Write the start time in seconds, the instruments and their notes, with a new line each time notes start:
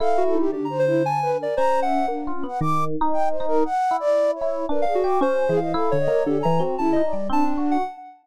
0.00 electric piano 1 E4, ocarina A4, flute F5
0.17 ocarina F#4
0.26 flute A4
0.34 ocarina D#4
0.39 flute G4
0.52 electric piano 1 D3, flute D4, ocarina G4
0.65 ocarina A#5
0.70 flute C5
0.79 ocarina C5
0.87 flute E4
1.04 ocarina G#5, flute A5
1.22 flute B4
1.39 flute A#4, ocarina D5
1.57 electric piano 1 C#4, ocarina C5, flute A#5
1.82 flute E5, ocarina F#5
2.08 electric piano 1 A#3, flute D4
2.27 electric piano 1 F4
2.35 flute C#4
2.43 electric piano 1 B3
2.48 flute F#5
2.61 electric piano 1 D#3, flute D6
3.01 electric piano 1 D#4
3.13 flute G5
3.30 flute C5
3.40 electric piano 1 D#4
3.48 flute A#4
3.65 flute F#5
3.91 electric piano 1 E4
4.00 flute D5
4.35 flute C#5
4.41 electric piano 1 E4
4.69 electric piano 1 D4, flute A#4, ocarina B4
4.82 electric piano 1 D4, ocarina F5
4.87 flute G#4
4.95 ocarina F#4
5.04 electric piano 1 G4, flute D6
5.21 electric piano 1 C#4, ocarina C5
5.48 electric piano 1 E3, flute G#4
5.57 ocarina F5
5.61 flute D#5
5.74 electric piano 1 E4, flute A4
5.91 electric piano 1 D3, ocarina C#5
6.00 flute D#5
6.08 electric piano 1 A#3
6.26 electric piano 1 D3, flute G4, ocarina A4
6.39 flute G#5, ocarina A#5
6.45 electric piano 1 E3
6.59 electric piano 1 C4, ocarina F#4
6.78 electric piano 1 C#3, flute E4, ocarina A5
6.92 electric piano 1 D#4, ocarina D#5
7.04 flute D5
7.13 electric piano 1 G3
7.29 electric piano 1 C4, flute D4, ocarina A5
7.44 ocarina D4
7.57 electric piano 1 F#4
7.71 ocarina F#5